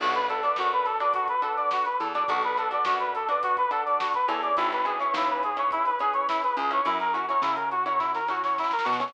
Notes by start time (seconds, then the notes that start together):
0.00 B1 D4 F#4 A4 B4, kick, crash
0.13 B4, snare, closed hi-hat
0.29 D4 F#4 A4 B4, closed hi-hat
0.43 D4 F#4 A4 B4 D5, closed hi-hat
0.56 F#2 F#4, snare
0.72 B4, closed hi-hat
0.85 A4, snare, closed hi-hat
1.00 D4 F#4 A4 B4 D5, closed hi-hat
1.14 F#4, kick, closed hi-hat
1.28 B4, kick, closed hi-hat
1.42 D4 F#4 A4 B4, closed hi-hat
1.56 D5, closed hi-hat
1.71 F#4, snare
1.85 B4, closed hi-hat
1.99 E2 A4, closed hi-hat
2.14 D4 F#4 A4 D5, closed hi-hat
2.18 B4
2.28 B1 D4 F#4 A4 B4, kick, closed hi-hat
2.42 B4, snare, closed hi-hat
2.57 D4 F#4 A4 B4, closed hi-hat
2.71 D4 F#4 A4 B4 D5, closed hi-hat
2.85 F#2 F#4, snare
3.00 B4, closed hi-hat
3.15 A4, closed hi-hat
3.29 D4 F#4 A4 B4 D5, closed hi-hat
3.43 F#4, kick, closed hi-hat
3.57 B4, kick, closed hi-hat
3.71 D4 F#4 A4 B4, closed hi-hat
3.85 D5, closed hi-hat
4.00 F#4, snare
4.14 B4, kick, closed hi-hat
4.28 E2 C#4 E4 G#4 A4, closed hi-hat
4.32 B4
4.43 D5, closed hi-hat
4.57 G#1 E4, kick, closed hi-hat
4.72 B4, snare, closed hi-hat
4.85 C#4 E4 G#4 B4, closed hi-hat
5.00 C#4 E4 G#4 B4 C#5, closed hi-hat
5.14 D#2 E4, snare
5.28 B4, closed hi-hat
5.43 G#4, closed hi-hat
5.57 C#4 E4 G#4 B4 C#5, closed hi-hat
5.71 E4, kick, closed hi-hat
5.85 B4, snare, closed hi-hat
5.99 C#4 E4 G#4 B4, closed hi-hat
6.13 C#5, closed hi-hat
6.28 E4, snare
6.43 B4, snare, closed hi-hat
6.57 C#2 G#4, closed hi-hat
6.71 C#4 E4 G#4 B4 C#5, closed hi-hat
6.85 F#2 C#4 E4 F#4 A#4, kick, closed hi-hat
7.00 A#4, snare, closed hi-hat
7.13 C#4 E4 F#4, closed hi-hat
7.17 A#4
7.28 C#4 E4 F#4 A#4 C#5, closed hi-hat
7.42 C#3 E4, snare
7.56 A#4, kick, closed hi-hat
7.71 F#4, snare, closed hi-hat
7.86 C#4 E4 F#4 A#4 C#5, closed hi-hat
7.99 E4, kick, snare
8.14 A#4, snare
8.28 C#4 E4 F#4 A#4, snare
8.44 C#5, snare
8.58 E4, snare
8.64 snare
8.71 A#4, snare
8.79 snare
8.84 B2 F#4, snare
8.93 snare
8.99 C#4 E4 F#4 A#4 C#5, snare
9.08 snare